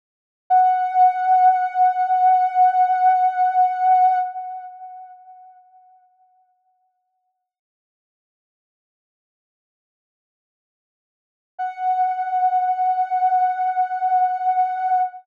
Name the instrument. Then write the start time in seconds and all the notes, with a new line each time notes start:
ocarina
0.50 F#5
11.58 F#5